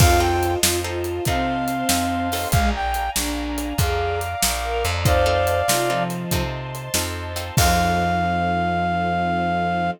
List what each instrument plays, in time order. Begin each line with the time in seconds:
0.00 electric bass (finger) F2, acoustic guitar (steel) C4 D#4 F4 A4, violin F4, string ensemble 1 C5 D#5 F5 A5, brass section F5, kick, crash
0.20 acoustic guitar (steel) C4 D#4 F4 A4, brass section G5
0.43 closed hi-hat
0.62 electric bass (finger) F2, acoustic guitar (steel) C4 D#4 F4 A4, violin F4, snare
0.84 acoustic guitar (steel) C4 D#4 F4 A4, violin F4
1.04 closed hi-hat
1.25 electric bass (finger) C3, violin C4, acoustic guitar (steel) C4 D#4 F4 A4, string ensemble 1 C5 D#5 A5 C6, brass section F5, kick, closed hi-hat
1.68 closed hi-hat
1.89 electric bass (finger) F2, acoustic guitar (steel) C4 D#4 F4 A4, snare
2.32 acoustic guitar (steel) C4 D#4 F4 A4, open hi-hat
2.52 electric bass (finger) A#1, violin G#3, string ensemble 1 D5 F5 G#5 A#5, brass section F5, kick, closed hi-hat
2.75 brass section G5
2.94 closed hi-hat
3.16 electric bass (finger) A#1, violin D4, snare
3.58 closed hi-hat
3.78 electric bass (finger) F2, violin G#4, string ensemble 1 D5 F5 A#5 D6, brass section F5, kick, closed hi-hat
4.21 closed hi-hat
4.42 electric bass (finger) A#1, snare
4.64 violin A#4
4.85 electric bass (finger) F2, closed hi-hat
5.05 acoustic guitar (steel) C4 D#4 F4 A4, string ensemble 1 C5 D#5 F5 A5, violin C5, brass section D5 F5, kick, closed hi-hat
5.26 acoustic guitar (steel) C4 D#4 F4 A4
5.47 closed hi-hat
5.68 electric bass (finger) C3, acoustic guitar (steel) C4 D#4 F4 A4, violin F4, snare
5.90 violin F3, acoustic guitar (steel) C4 D#4 F4 A4
6.10 closed hi-hat
6.30 electric bass (finger) C3, acoustic guitar (steel) C4 D#4 F4 A4, string ensemble 1 C5 D#5 A5 C6, kick, closed hi-hat
6.75 closed hi-hat
6.94 electric bass (finger) F2, acoustic guitar (steel) C4 D#4 F4 A4, snare
7.36 acoustic guitar (steel) C4 D#4 F4 A4, closed hi-hat
7.57 electric bass (finger) F2, violin F3, string ensemble 1 C4 D#4 F4 A4, acoustic guitar (steel) C4 D#4 F4 A4, brass section F5, kick, crash